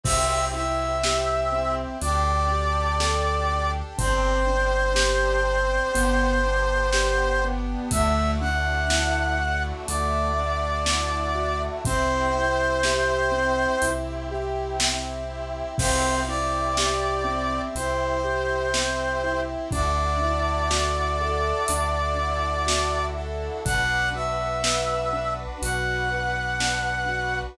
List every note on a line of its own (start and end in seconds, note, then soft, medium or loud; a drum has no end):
0.03 1.86 C2 medium
0.03 1.98 C4 medium
0.03 0.49 C4 loud
0.03 1.98 E4 medium
0.03 1.98 G4 medium
0.03 0.45 E5 loud
0.03 kick loud
0.03 crash loud
0.53 0.98 E4 medium
0.53 1.75 E5 medium
1.03 1.49 G4 medium
1.03 snare loud
1.52 1.97 C4 medium
2.01 3.83 D2 medium
2.01 2.45 D4 loud
2.01 3.97 D4 medium
2.01 3.97 G4 medium
2.01 3.97 A4 medium
2.01 3.71 D5 medium
2.01 closed hi-hat loud
2.51 2.96 G4 medium
3.00 3.45 A4 medium
3.00 snare loud
3.51 3.95 D4 medium
3.98 5.80 G1 medium
3.98 4.43 C4 loud
3.98 5.94 C4 medium
3.98 5.94 D4 medium
3.98 5.94 G4 medium
3.98 7.44 C5 loud
3.98 kick loud
3.98 closed hi-hat loud
4.47 4.91 D4 medium
4.95 5.40 G4 medium
4.95 snare loud
5.47 5.91 C4 medium
5.94 7.76 G1 medium
5.94 7.89 B3 medium
5.94 6.39 B3 loud
5.94 7.89 D4 medium
5.94 7.89 G4 medium
5.94 closed hi-hat loud
6.46 6.90 D4 medium
6.93 7.38 G4 medium
6.93 snare loud
7.44 7.89 B3 loud
7.91 9.73 D2 medium
7.91 11.81 A3 medium
7.91 8.37 A3 loud
7.91 11.81 D4 medium
7.91 11.81 E4 medium
7.91 11.81 F#4 medium
7.91 8.31 E5 loud
7.91 kick loud
7.91 closed hi-hat loud
8.41 8.86 D4 medium
8.41 9.63 F#5 medium
8.90 9.34 E4 medium
8.90 snare loud
9.40 9.84 F#4 medium
9.87 11.69 D2 medium
9.87 10.31 A3 medium
9.87 11.62 D5 medium
9.87 closed hi-hat loud
10.39 10.83 D4 medium
10.86 11.33 E4 loud
10.86 snare loud
11.35 11.79 F#4 medium
11.85 13.66 C2 medium
11.85 15.75 C4 medium
11.85 12.31 C4 loud
11.85 15.75 E4 medium
11.85 15.75 G4 medium
11.85 13.90 C5 loud
11.85 kick loud
11.85 closed hi-hat loud
12.35 12.80 E4 loud
12.83 13.29 G4 medium
12.83 snare loud
13.32 13.76 C4 medium
13.82 15.63 C2 medium
13.82 14.27 E4 medium
13.82 closed hi-hat loud
14.31 14.76 G4 medium
14.79 15.24 C4 medium
14.79 snare loud
15.30 15.74 E4 medium
15.78 17.60 C2 medium
15.78 16.23 C4 loud
15.78 19.69 C4 medium
15.78 19.69 E4 medium
15.78 19.69 G4 medium
15.78 16.20 C5 loud
15.78 kick loud
15.78 crash loud
16.28 16.72 E4 medium
16.28 17.61 D5 medium
16.77 17.22 G4 medium
16.77 snare loud
17.24 17.69 C4 loud
17.75 19.56 C2 medium
17.75 18.20 E4 loud
17.75 19.41 C5 medium
17.75 closed hi-hat loud
18.24 18.68 G4 medium
18.74 19.19 C4 medium
18.74 snare loud
19.24 19.68 E4 medium
19.71 21.53 D2 medium
19.71 20.16 D4 loud
19.71 23.62 D4 medium
19.71 23.62 E4 medium
19.71 23.62 F#4 medium
19.71 23.62 A4 medium
19.71 23.06 D5 medium
19.71 kick loud
19.71 closed hi-hat medium
20.22 20.66 E4 medium
20.70 21.14 F#4 medium
20.70 snare loud
21.21 21.65 A4 loud
21.68 23.50 D2 medium
21.68 22.14 D4 medium
21.68 closed hi-hat loud
22.19 22.64 E4 loud
22.67 23.11 F#4 medium
22.67 snare loud
23.17 23.62 A4 medium
23.65 25.46 B1 medium
23.65 24.09 D4 loud
23.65 27.56 D4 medium
23.65 27.56 F#4 medium
23.65 27.56 B4 medium
23.65 24.09 F#5 loud
23.65 kick loud
23.65 closed hi-hat loud
24.15 24.59 F#4 medium
24.15 25.34 E5 medium
24.63 25.07 B4 medium
24.63 snare loud
25.13 25.57 D4 medium
25.62 27.43 B1 medium
25.62 26.07 F#4 loud
25.62 27.39 F#5 medium
25.62 closed hi-hat loud
26.11 26.55 B4 medium
26.60 27.05 D4 medium
26.60 snare loud
27.08 27.53 F#4 medium